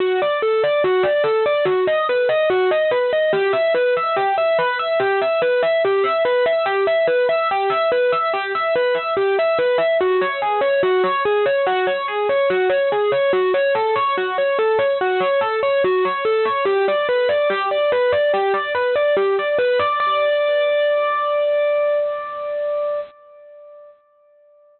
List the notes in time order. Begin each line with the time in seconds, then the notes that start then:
0.00 F#4
0.22 D5
0.42 A4
0.64 D5
0.84 F#4
1.03 D5
1.24 A4
1.46 D5
1.65 F#4
1.87 D#5
2.09 B4
2.29 D#5
2.50 F#4
2.71 D#5
2.91 B4
3.13 D#5
3.33 G4
3.53 E5
3.74 B4
3.97 E5
4.16 G4
4.38 E5
4.59 B4
4.79 E5
5.00 G4
5.22 E5
5.42 B4
5.62 E5
5.85 G4
6.04 E5
6.25 B4
6.46 E5
6.66 G4
6.87 E5
7.07 B4
7.29 E5
7.51 G4
7.70 E5
7.92 B4
8.12 E5
8.34 G4
8.55 E5
8.76 B4
8.94 E5
9.17 G4
9.39 E5
9.59 B4
9.78 E5
10.01 F#4
10.21 C#5
10.42 G#4
10.61 C#5
10.83 F#4
11.04 C#5
11.25 G#4
11.46 C#5
11.66 F#4
11.87 C#5
12.08 G#4
12.29 C#5
12.50 F#4
12.69 C#5
12.92 G#4
13.12 C#5
13.33 F#4
13.54 C#5
13.75 A4
13.96 C#5
14.18 F#4
14.38 C#5
14.59 A4
14.79 C#5
15.01 F#4
15.20 C#5
15.41 A4
15.63 C#5
15.84 F#4
16.05 C#5
16.25 A4
16.45 C#5
16.65 G4
16.88 D5
17.09 B4
17.29 D5
17.50 G4
17.71 D5
17.92 B4
18.12 D5
18.34 G4
18.54 D5
18.75 B4
18.96 D5
19.17 G4
19.39 D5
19.59 B4
19.79 D5
20.00 D5